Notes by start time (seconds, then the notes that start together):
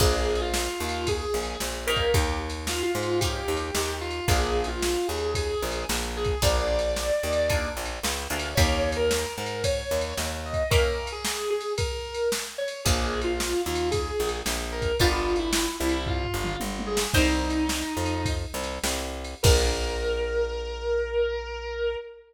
0.00 A#1 A#3 D4 F4 G#4, kick, crash
0.35 ride
0.41 F4
0.54 snare
0.80 D#2 F4
0.89 ride
1.07 G#4, kick, ride
1.34 A#1
1.43 ride
1.60 A#1, snare
1.87 A#3 C#4 D#4 G4 A#4
1.96 kick, ride
2.14 D#2 G4, kick, ride
2.50 ride
2.67 F4, snare
2.83 F4
2.95 G#2
3.03 ride
3.20 A#3 C#4 D#4 G4, kick, ride
3.48 D#2
3.57 ride
3.75 D#2, snare
4.01 F4
4.10 ride
4.28 A#1 A#3 D4 F4 G#4, kick, ride
4.64 F4, ride
4.82 snare
5.08 D#2 G#4
5.18 ride
5.35 G#4, kick, ride
5.62 A#1
5.72 ride
5.89 A#1, snare
6.17 G#4
6.24 kick, ride
6.42 A#1 A#3 D4 F4 G#4 D5, kick, ride
6.79 ride
6.96 snare
7.23 D#2
7.33 ride
7.50 A#3 D4 F4 G#4, kick, ride
7.77 A#1
7.86 ride
8.03 C#2, snare
8.30 D2 A#3 D4 F4 G#4
8.40 ride
8.55 D#2 A#3 C#4 D#4 G4 C#5, kick, ride
8.92 ride
8.96 A#4
9.11 snare
9.38 G#2 A#4
9.46 ride
9.64 C#5, kick, ride
9.91 D#2
10.01 ride
10.17 D#2, snare
10.46 D#5
10.53 kick, ride
10.70 A#3 C#4 E4 G4 A#4, kick, ride
11.07 ride
11.12 G#4
11.25 snare
11.50 G#4
11.60 ride
11.78 A#4, kick, ride
12.14 ride
12.32 snare
12.58 C#5
12.68 ride
12.85 A#1 A#3 D4 F4 G#4, kick, ride
13.21 F4, ride
13.40 snare
13.66 D#2 F4
13.75 ride
13.91 G#4, kick, ride
14.20 A#1
14.29 ride
14.46 A#1, snare
14.72 A#4
14.82 kick, ride
14.99 G1 B3 D4 F4 G4, kick, ride
15.36 E4, ride
15.53 snare
15.80 C2 E4
15.89 ride
16.06 F4, kick, floor tom
16.24 floor tom
16.34 G1
16.44 mid tom
16.60 G1, high tom
16.79 high tom
16.86 G#4
16.97 snare
17.14 C2 D#4 A#4 C5 D#5 G5, kick, crash
17.50 ride
17.69 snare
17.97 F2
18.06 ride
18.25 kick, ride
18.54 C2
18.63 ride
18.84 C2, snare
19.24 ride
19.43 A#1 A#3 D4 F4 G#4 A#4, kick, crash